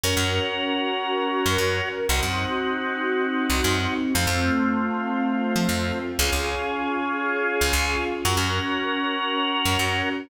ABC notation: X:1
M:4/4
L:1/16
Q:1/4=117
K:Bbm
V:1 name="Drawbar Organ"
[DGB]16 | [CEG]16 | [=A,CF]16 | [DFA]16 |
[DGB]16 |]
V:2 name="Electric Bass (finger)" clef=bass
G,, G,,10 G,, G,,4 | C,, G,,10 C,, G,,4 | F,, F,,10 F, F,,4 | D,, D,,10 D,, D,,4 |
G,, G,,10 G,, G,,4 |]
V:3 name="String Ensemble 1"
[DGB]16 | [CEG]16 | [=A,CF]16 | [DFA]16 |
[DGB]16 |]